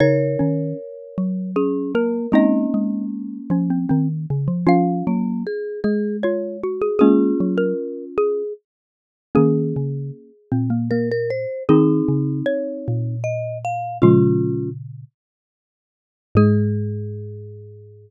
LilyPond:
<<
  \new Staff \with { instrumentName = "Xylophone" } { \time 3/4 \key aes \mixolydian \tempo 4 = 77 des''2 aes'8 bes'8 | ees''4 r2 | f''8 r4. des''8 r16 aes'16 | aes'8. bes'8. aes'8 r4 |
aes'2. | aes'4 des''4 r4 | f'4 r2 | aes'2. | }
  \new Staff \with { instrumentName = "Marimba" } { \time 3/4 \key aes \mixolydian <bes' des''>2 des'8 bes8 | <bes des'>2. | r8 bes8 aes'8 aes'8 r4 | <des' f'>2 r4 |
r2 bes'16 bes'16 c''8 | <c' ees'>2 ees''8 f''8 | <des' f'>4 r2 | aes'2. | }
  \new Staff \with { instrumentName = "Xylophone" } { \time 3/4 \key aes \mixolydian ees'8 des'8 r2 | <c' ees'>4. des'16 c'16 c'16 r8. | <des' f'>2 f'8 ges'8 | <bes des'>4 r2 |
<bes des'>4. c'16 bes16 bes16 r8. | <c' ees'>2. | <f aes>4 r2 | aes2. | }
  \new Staff \with { instrumentName = "Xylophone" } { \clef bass \time 3/4 \key aes \mixolydian des8 ees8 r8 ges4. | aes8 aes4 f8 ees8 des16 f16 | f8 ges8 r8 aes4. | aes8 ges8 r2 |
ees8 des8 r8 bes,4. | ees8 des8 r8 bes,4. | <bes, des>4. r4. | aes,2. | }
>>